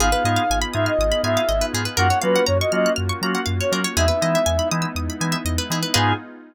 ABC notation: X:1
M:4/4
L:1/16
Q:1/4=121
K:G#m
V:1 name="Ocarina"
^e6 =e d3 e4 z2 | f2 B2 c d d2 z5 c z2 | e6 z10 | g4 z12 |]
V:2 name="Drawbar Organ"
[B,D^EG]2 [B,DEG]4 [B,DEG]4 [B,DEG]4 [B,DEG]2 | [A,C^EF]2 [A,CEF]4 [A,CEF]4 [A,CEF]4 [A,CEF]2 | [G,B,DE]2 [G,B,DE]4 [G,B,DE]4 [G,B,DE]4 [G,B,DE]2 | [B,D^EG]4 z12 |]
V:3 name="Pizzicato Strings"
G B d ^e g b d' ^e' d' b g e d B G B | A c ^e f a c' ^e' f' e' c' a f e c A c | G B d e g b d' e' d' b g e d B G B | [GBd^e]4 z12 |]
V:4 name="Synth Bass 2" clef=bass
G,,,2 G,,2 G,,,2 G,,2 G,,,2 G,,2 G,,,2 G,,2 | F,,2 F,2 F,,2 F,2 F,,2 F,2 F,,2 F,2 | E,,2 E,2 E,,2 E,2 E,,2 E,2 E,,2 E,2 | G,,4 z12 |]
V:5 name="Pad 5 (bowed)"
[B,D^EG]16 | [A,C^EF]16 | [G,B,DE]16 | [B,D^EG]4 z12 |]